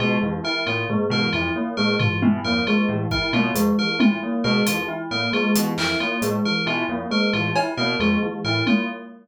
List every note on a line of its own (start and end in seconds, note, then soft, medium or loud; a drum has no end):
0.00 0.17 B2 medium
0.00 0.17 G#3 medium
0.00 0.17 F4 medium
0.22 0.41 F2 medium
0.22 0.39 E3 medium
0.44 0.62 E4 medium
0.44 0.62 A#4 medium
0.66 0.85 A2 medium
0.66 0.84 A#3 medium
0.66 0.84 F4 medium
0.89 1.07 G#3 medium
0.89 floor tom medium
1.10 1.28 B2 medium
1.10 1.29 E3 medium
1.10 1.29 A#4 medium
1.33 1.51 F2 medium
1.33 1.52 E4 medium
1.33 1.50 F4 medium
1.56 1.73 A#3 medium
1.77 1.96 A2 medium
1.77 1.95 G#3 medium
1.77 1.95 A#4 medium
1.99 2.19 E3 medium
1.99 2.17 F4 medium
1.99 floor tom loud
2.22 2.40 B2 medium
2.22 2.40 E4 medium
2.22 high tom loud
2.44 2.62 F2 medium
2.44 2.63 A#3 medium
2.44 2.62 A#4 medium
2.67 2.85 G#3 medium
2.67 2.85 F4 medium
2.89 3.06 A2 medium
2.89 3.06 E3 medium
3.11 3.29 E4 medium
3.11 3.29 A#4 medium
3.11 kick medium
3.33 3.51 B2 medium
3.33 3.51 A#3 medium
3.33 3.51 F4 medium
3.33 high tom medium
3.55 3.73 F2 medium
3.55 3.72 G#3 medium
3.55 closed hi-hat medium
3.78 3.96 E3 medium
3.78 3.96 A#4 medium
3.99 4.18 A2 medium
3.99 4.17 E4 medium
3.99 4.18 F4 medium
3.99 high tom loud
4.23 4.41 A#3 medium
4.44 4.62 B2 medium
4.44 4.63 G#3 medium
4.44 4.62 A#4 medium
4.66 4.85 F2 medium
4.66 4.85 E3 medium
4.66 4.84 F4 medium
4.66 closed hi-hat medium
4.88 5.06 E4 medium
5.11 5.29 A2 medium
5.11 5.29 A#3 medium
5.11 5.29 A#4 medium
5.33 5.51 G#3 medium
5.33 5.51 F4 medium
5.55 5.73 B2 medium
5.55 5.73 E3 medium
5.55 closed hi-hat medium
5.77 5.95 F2 medium
5.77 5.97 E4 medium
5.77 5.96 A#4 medium
5.77 clap medium
6.00 6.18 A#3 medium
6.00 6.18 F4 medium
6.22 6.40 A2 medium
6.22 6.40 G#3 medium
6.22 closed hi-hat medium
6.45 6.63 E3 medium
6.45 6.63 A#4 medium
6.66 6.84 B2 medium
6.66 6.84 E4 medium
6.66 6.85 F4 medium
6.89 7.06 F2 medium
6.89 7.07 A#3 medium
7.11 7.28 G#3 medium
7.11 7.29 A#4 medium
7.33 7.51 A2 medium
7.33 7.52 E3 medium
7.33 7.51 F4 medium
7.56 7.74 E4 medium
7.56 cowbell loud
7.77 7.95 B2 medium
7.77 7.96 A#3 medium
7.77 7.95 A#4 medium
8.00 8.17 F2 medium
8.00 8.18 G#3 medium
8.00 8.18 F4 medium
8.22 8.40 E3 medium
8.44 8.62 A2 medium
8.44 8.63 E4 medium
8.44 8.62 A#4 medium
8.67 8.85 A#3 medium
8.67 8.84 F4 medium
8.67 high tom medium